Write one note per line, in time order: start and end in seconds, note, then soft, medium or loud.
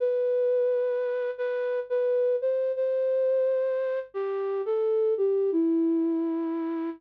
0.00 1.30 B4 loud
1.38 1.80 B4 loud
1.90 2.36 B4 medium
2.42 2.72 C5 loud
2.76 3.99 C5 loud
4.14 4.62 G4 medium
4.66 5.14 A4 loud
5.17 5.51 G4 medium
5.52 6.90 E4 loud